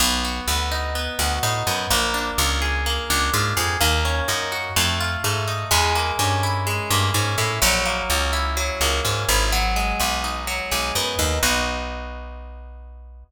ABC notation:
X:1
M:4/4
L:1/8
Q:1/4=126
K:B
V:1 name="Acoustic Guitar (steel)"
B, F B, D B, F D B, | A, =D ^E G A, D E G | A, C D F =A, =F A, _E | G, A, C E G, A, C E |
F, A, C E F, A, C E | F, G, B, D F, G, B, D | [B,DF]8 |]
V:2 name="Electric Bass (finger)" clef=bass
B,,,2 =D,,3 D,, =A,, F,, | A,,,2 C,,3 C,, G,, ^E,, | D,,2 F,,2 =F,,2 G,,2 | E,,2 =G,,3 G,, ^G,, =A,, |
A,,,2 C,,3 C,, G,, G,,,- | G,,,2 B,,,3 B,,, F,, D,, | B,,,8 |]